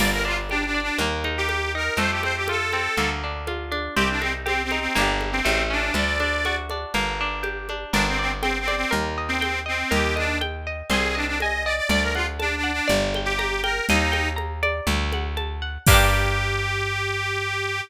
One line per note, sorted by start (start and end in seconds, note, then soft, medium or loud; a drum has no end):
0.00 0.91 G1 medium
0.00 0.94 A#3 medium
0.00 0.11 D5 medium
0.00 crash medium
0.00 low conga medium
0.12 0.24 A#4 medium
0.25 0.74 D4 medium
0.25 0.37 F4 medium
0.49 0.64 D4 medium
0.49 0.98 G4 medium
0.49 high conga medium
0.65 0.81 D4 medium
0.74 0.98 D4 medium
0.82 0.98 D4 medium
0.98 1.90 D#2 medium
0.98 1.95 A#3 medium
0.98 low conga medium
1.24 1.74 D#4 medium
1.24 high conga medium
1.38 1.72 G4 medium
1.49 1.96 G4 medium
1.49 high conga medium
1.75 1.98 D#4 medium
1.75 1.98 A#4 medium
1.97 2.88 F2 medium
1.97 2.92 A3 medium
1.97 2.11 C5 medium
1.97 low conga medium
2.10 2.22 G4 medium
2.23 2.73 C4 medium
2.23 2.36 C5 medium
2.23 high conga medium
2.36 2.47 G4 medium
2.48 2.96 F4 medium
2.48 3.10 A4 medium
2.48 high conga medium
2.73 2.97 C4 medium
2.73 high conga medium
2.97 3.89 D2 medium
2.97 3.92 A#3 medium
2.97 low conga medium
3.23 3.71 D4 medium
3.47 3.95 F4 medium
3.47 high conga medium
3.71 3.95 D4 medium
3.71 high conga medium
3.96 4.88 C2 medium
3.96 4.91 C4 medium
3.96 4.08 G4 medium
3.96 low conga medium
4.09 4.21 D4 medium
4.21 4.33 C4 medium
4.21 4.71 D#4 medium
4.21 high conga medium
4.46 4.62 C4 medium
4.46 4.93 G4 medium
4.46 high conga medium
4.63 4.79 C4 medium
4.71 4.95 D#4 medium
4.71 high conga medium
4.80 4.95 C4 medium
4.95 5.42 G1 medium
4.95 5.40 A#3 medium
4.95 5.40 D4 medium
4.95 low conga medium
5.01 5.40 G4 medium
5.21 high conga medium
5.33 5.63 C4 medium
5.45 5.91 A1 medium
5.45 5.92 A3 medium
5.45 high conga medium
5.70 5.94 C#4 medium
5.70 5.94 D4 medium
5.94 6.85 D2 medium
5.94 6.89 A3 medium
5.94 6.56 D5 medium
5.94 low conga medium
6.20 6.70 D4 medium
6.20 high conga medium
6.45 6.93 F#4 medium
6.45 high conga medium
6.70 6.94 D4 medium
6.70 high conga medium
6.94 7.85 G1 medium
6.94 7.89 A#3 medium
6.94 low conga medium
7.21 7.69 D4 medium
7.43 7.90 G4 medium
7.43 high conga medium
7.69 7.93 D4 medium
7.69 high conga medium
7.93 8.85 G1 medium
7.93 8.06 D4 loud
7.93 8.87 A#4 loud
7.93 low conga medium
8.07 8.19 C4 medium
8.19 8.31 C4 medium
8.19 8.67 D5 medium
8.42 8.58 C4 medium
8.42 8.90 G5 medium
8.42 high conga medium
8.60 8.75 C4 medium
8.68 8.91 D5 medium
8.68 high conga medium
8.76 8.92 C4 loud
8.91 9.84 D#2 medium
8.91 9.85 A#4 medium
8.91 low conga medium
9.18 9.65 D#5 medium
9.29 9.59 C4 medium
9.41 9.89 G5 medium
9.41 high conga medium
9.66 9.91 C4 medium
9.66 9.89 D#5 medium
9.91 10.83 D#2 medium
9.91 10.14 G4 loud
9.91 10.85 A#4 medium
9.91 low conga medium
10.16 10.38 D4 medium
10.16 10.66 D#5 medium
10.16 high conga medium
10.41 10.88 G5 medium
10.41 high conga medium
10.67 10.90 D#5 medium
10.90 11.81 C2 medium
10.90 11.15 G#4 medium
10.90 11.85 C5 loud
10.90 low conga medium
11.15 11.26 D4 medium
11.15 11.66 D#5 medium
11.26 11.38 D4 medium
11.39 11.63 D#5 medium
11.39 11.89 G#5 medium
11.39 high conga medium
11.65 11.76 D5 medium
11.65 11.90 D#5 medium
11.76 11.88 D5 medium
11.89 12.81 D2 medium
11.89 12.85 D5 medium
11.89 12.03 D5 loud
11.89 low conga medium
12.01 12.13 A#4 medium
12.14 12.26 F4 medium
12.14 12.63 F#5 medium
12.14 high conga medium
12.39 12.55 D4 medium
12.39 12.87 A5 medium
12.39 high conga medium
12.56 12.71 D4 medium
12.64 12.87 F#5 medium
12.72 12.88 D4 loud
12.88 13.81 G1 medium
12.88 13.82 D5 loud
12.88 low conga medium
13.14 13.63 G5 medium
13.14 high conga medium
13.25 13.61 G4 medium
13.39 13.86 A#5 medium
13.39 high conga medium
13.62 13.86 A#4 medium
13.62 13.87 G5 medium
13.62 high conga medium
13.88 14.81 D#2 loud
13.88 14.29 D#4 loud
13.88 14.84 D#5 loud
13.88 low conga medium
14.12 14.83 G5 medium
14.12 high conga medium
14.36 14.83 A#5 medium
14.36 high conga medium
14.63 15.82 D5 loud
14.63 high conga medium
14.87 15.78 D2 medium
14.87 low conga medium
15.13 15.61 F#5 medium
15.13 high conga medium
15.37 15.84 A5 medium
15.37 high conga medium
15.62 15.86 F#5 medium
15.86 17.81 G2 loud
15.86 17.82 A#3 loud
15.86 17.81 G4 loud
15.86 kick loud
15.86 crash loud
15.91 17.82 D4 medium
15.91 17.82 G4 loud